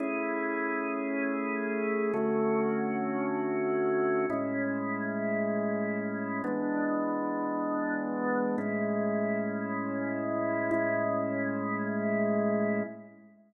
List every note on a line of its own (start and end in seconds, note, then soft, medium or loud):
0.00 2.12 A3 medium
0.00 2.12 C#4 medium
0.00 2.12 E4 medium
0.00 2.12 G#4 medium
2.13 4.26 D3 medium
2.13 4.26 A3 medium
2.13 4.26 C#4 medium
2.13 4.26 F#4 medium
4.30 6.42 A2 medium
4.30 6.42 G#3 medium
4.30 6.42 C#4 medium
4.30 6.42 E4 medium
6.44 8.56 E3 medium
6.44 8.56 G#3 medium
6.44 8.56 B3 medium
6.44 8.56 D4 medium
8.58 10.70 A2 medium
8.58 10.70 G#3 medium
8.58 10.70 C#4 medium
8.58 10.70 E4 medium
10.71 12.83 A2 medium
10.71 12.83 G#3 medium
10.71 12.83 C#4 medium
10.71 12.83 E4 medium